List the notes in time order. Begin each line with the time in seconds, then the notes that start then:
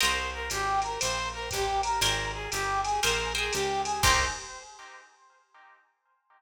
0.00 C2 A#4 C5 D#5 G5, ride
0.33 A#4
0.50 G#1 G4, hi-hat pedal, ride
0.82 A#4, ride
0.99 A#1 C5, ride
1.33 A#4
1.51 A1 G4, kick, hi-hat pedal, ride
1.83 A#4, ride
2.01 G#1 A#4 C5 G5 G#5, ride
2.33 G#4
2.51 G1 G4, hi-hat pedal, ride
2.84 G#4, ride
3.03 A#1 A#4 C5 G5 G#5, ride
3.35 G#4 A#4 C5 G5 G#5
3.52 C#2 G4, hi-hat pedal, ride
3.84 G#4, ride
4.02 C2 A#3 C4 D#4 G4 C5, kick, crash